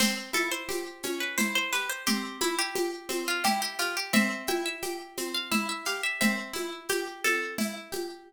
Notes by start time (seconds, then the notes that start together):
0.00 C4 C5, crash, low conga, shaker
0.33 E4 A4, high conga, shaker
0.51 C5
0.69 G4, high conga, shaker
1.03 C#4, high conga, shaker
1.20 B4
1.38 E4 C5, low conga, shaker
1.55 C5
1.72 G4 B4, shaker
1.90 C5
2.06 C4 G4, low conga, shaker
2.41 E4, high conga, shaker
2.59 G4
2.75 G4, high conga, shaker
3.09 C4, high conga, shaker
3.28 F4
3.44 E4 G4, low conga, shaker
3.62 G4
3.79 F4 G4, shaker
3.97 G4
4.13 C4 E5, low conga, shaker
4.47 E4 G5, high conga, shaker
4.66 E5
4.82 G4, high conga, shaker
5.17 C4, high conga, shaker
5.34 F5
5.51 E4 E5, low conga, shaker
5.69 E5
5.85 G4 F5, shaker
6.03 E5
6.21 C4 E5, low conga, shaker
6.53 E4, high conga, shaker
6.89 G4, high conga, shaker
7.24 C4 A4, high conga, shaker
7.58 E4, low conga, shaker
7.92 G4, high conga, shaker